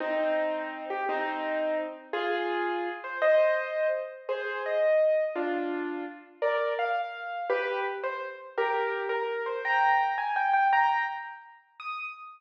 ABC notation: X:1
M:6/8
L:1/8
Q:3/8=112
K:Eb
V:1 name="Acoustic Grand Piano"
[CE]5 G | [CE]4 z2 | [FA]5 c | [ce]4 z2 |
[K:Cm] [Ac]2 e4 | [DF]4 z2 | [Bd]2 f4 | [G=B]2 z c z2 |
[K:Eb] [GB]3 B2 c | [gb]3 a g g | [gb]2 z4 | e'3 z3 |]